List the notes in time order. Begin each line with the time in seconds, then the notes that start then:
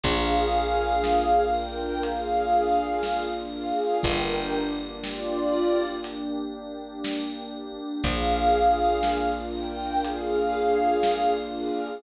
0.04 A#1 A#3 D4 F4 G#4 A#4 F5, kick, closed hi-hat
0.54 D5
1.04 F5, snare
1.54 A#4 G5
2.03 G#4 D5 F5, closed hi-hat
2.53 F5
3.03 A#4, snare
3.54 G#4 D5 F5
4.03 G1 A#3 D4 G4 A#4 G5, kick, closed hi-hat
4.54 D5
5.03 F4 D5 G5, snare
5.54 A#4
6.04 D5, closed hi-hat
6.54 G5
7.04 A#4, snare
7.54 D5
8.03 A#1 A#3 D4 F4 G#4 A#4 F5, kick, closed hi-hat
8.53 D5
9.03 F5, snare
9.53 A#4 G5
10.04 G#4 D5 F5, closed hi-hat
10.54 F5
11.03 A#4, snare
11.54 G#4 D5 F5